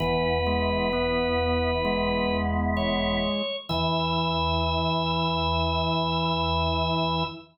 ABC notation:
X:1
M:4/4
L:1/8
Q:1/4=65
K:E
V:1 name="Drawbar Organ"
B6 c2 | e8 |]
V:2 name="Drawbar Organ"
B,8 | E8 |]
V:3 name="Drawbar Organ"
E, G, B,2 G,4 | E,8 |]
V:4 name="Drawbar Organ" clef=bass
[E,,,E,,]8 | E,,8 |]